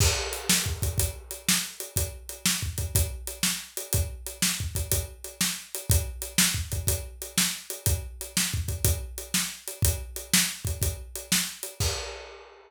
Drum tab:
CC |x-----------|------------|------------|------------|
HH |--x--xx-x--x|x-x--xx-x--x|x-x--xx-x--x|x-x--xx-x--x|
SD |---o-----o--|---o-----o--|---o-----o--|---o-----o--|
BD |o---ooo-----|o---ooo-----|o---ooo-----|o---ooo-----|

CC |------------|------------|x-----------|
HH |x-x--xx-x--x|x-x--xx-x--x|------------|
SD |---o-----o--|---o-----o--|------------|
BD |o---ooo-----|o----oo-----|o-----------|